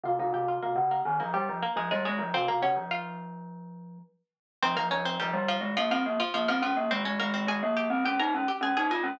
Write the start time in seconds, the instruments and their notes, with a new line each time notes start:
0.03 glockenspiel C3, harpsichord F4 F5
0.19 glockenspiel C3, harpsichord D#4 D#5
0.33 glockenspiel C3, harpsichord G4 G5
0.48 harpsichord F4 F5
0.63 glockenspiel C3, harpsichord A#3 A#4
0.75 glockenspiel C#3
0.91 harpsichord A#3 A#4
1.05 glockenspiel D#3
1.20 glockenspiel F3, harpsichord A#3 A#4
1.34 harpsichord G3 G4, glockenspiel G3
1.49 glockenspiel F3
1.63 harpsichord A#3 A#4
1.76 glockenspiel F3, harpsichord G#3 G#4
1.91 glockenspiel G3, harpsichord G#3 G#4
2.05 harpsichord G#3 G#4, glockenspiel G#3
2.19 glockenspiel F3
2.34 glockenspiel C3, harpsichord C4 C5
2.48 glockenspiel C3, harpsichord A#3 A#4
2.62 glockenspiel C#3, harpsichord C#4 C#5
2.76 glockenspiel F3
2.91 harpsichord F4 F5
4.63 glockenspiel F3, harpsichord C4 C5
4.76 glockenspiel F3, harpsichord A#3 A#4
4.91 glockenspiel F3, harpsichord C#4 C#5
5.05 harpsichord C4 C5
5.20 glockenspiel F3, harpsichord G3 G4
5.33 glockenspiel G3
5.48 harpsichord F3 F4
5.61 glockenspiel G#3
5.77 harpsichord F3 F4, glockenspiel A#3
5.91 harpsichord F3 F4, glockenspiel C4
6.06 glockenspiel A#3
6.20 harpsichord F3 F4
6.34 harpsichord F3 F4, glockenspiel A#3
6.48 harpsichord F3 F4, glockenspiel C4
6.62 harpsichord F3 F4, glockenspiel C#4
6.77 glockenspiel A#3
6.90 glockenspiel G#3, harpsichord C4 C5
7.05 glockenspiel G#3, harpsichord C#4 C#5
7.20 glockenspiel G#3, harpsichord A#3 A#4
7.34 harpsichord C4 C5
7.47 glockenspiel G#3, harpsichord G#4 G#5
7.63 glockenspiel A#3
7.77 harpsichord G4 G5
7.90 glockenspiel C4
8.05 glockenspiel C#4, harpsichord G4 G5
8.20 glockenspiel D#4, harpsichord A#4 A#5
8.34 glockenspiel C#4
8.48 harpsichord G4 G5
8.61 glockenspiel C#4, harpsichord G#4 G#5
8.77 glockenspiel D#4, harpsichord G#4 G#5
8.91 glockenspiel F4, harpsichord G#4 G#5
9.03 glockenspiel C#4